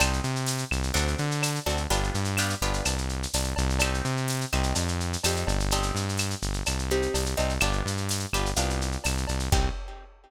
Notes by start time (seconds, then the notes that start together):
0.00 C2 C4 D#4 G4, cowbell, claves, shaker
0.13 shaker
0.24 C3, shaker
0.36 shaker
0.46 tambourine, shaker
0.58 shaker
0.71 C2, claves, shaker
0.83 shaker
0.94 D2 C4 D4 F#4 A4, cowbell, shaker
1.08 shaker
1.18 D3, shaker
1.31 shaker
1.42 tambourine, cowbell, claves, shaker
1.55 shaker
1.66 D2 C4 D4 F#4 A4, cowbell, shaker
1.77 shaker
1.90 G1 B3 D4 F4 G4, cowbell, shaker
2.04 shaker
2.14 G2, shaker
2.25 shaker
2.37 B3 D4 F4 G4, tambourine, claves, shaker
2.50 shaker
2.62 G1 B3 D4 F4 G4, shaker
2.74 shaker
2.85 C2, cowbell, claves, shaker
2.98 shaker
3.09 shaker
3.23 shaker
3.34 C2, tambourine, cowbell, shaker
3.44 shaker
3.56 C2, cowbell, shaker
3.70 shaker
3.79 C4 D#4 G4, cowbell, claves, shaker
3.94 shaker
4.05 C3, shaker
4.17 shaker
4.28 tambourine, shaker
4.41 shaker
4.52 C2 C4 D#4 G4, claves, shaker
4.63 shaker
4.75 F2, cowbell, shaker
4.88 shaker
5.00 shaker
5.13 shaker
5.24 F2 C4 D#4 G4, tambourine, cowbell, claves, shaker
5.36 shaker
5.47 G1, cowbell, shaker
5.60 shaker
5.71 C4 D#4 G4, cowbell, shaker
5.83 shaker
5.95 G2, shaker
6.09 shaker
6.17 tambourine, claves, shaker
6.30 shaker
6.42 G1, shaker
6.53 shaker
6.66 C2, cowbell, claves, shaker
6.79 shaker
6.90 C4 D#4 G4, shaker
7.02 shaker
7.14 C2, tambourine, cowbell, shaker
7.26 shaker
7.37 C2 C4 D#4 G4, cowbell, shaker
7.49 shaker
7.60 G1 B3 D4 F4 G4, cowbell, claves, shaker
7.73 shaker
7.86 G2, shaker
7.97 shaker
8.09 tambourine, shaker
8.20 shaker
8.33 G1 B3 D4 F4 G4, claves, shaker
8.46 shaker
8.56 C2 B3 D4 F4 G4, cowbell, shaker
8.70 shaker
8.81 shaker
8.92 shaker
9.04 C2, tambourine, cowbell, claves, shaker
9.17 shaker
9.27 C2, cowbell, shaker
9.39 shaker
9.52 C2 C4 D#4 G4, kick, crash